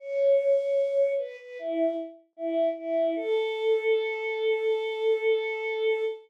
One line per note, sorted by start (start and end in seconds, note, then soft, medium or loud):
0.00 1.13 C#5 medium
1.18 1.37 B4 medium
1.39 1.58 B4 medium
1.59 1.96 E4 medium
2.37 2.69 E4 medium
2.77 3.14 E4 medium
3.16 6.04 A4 loud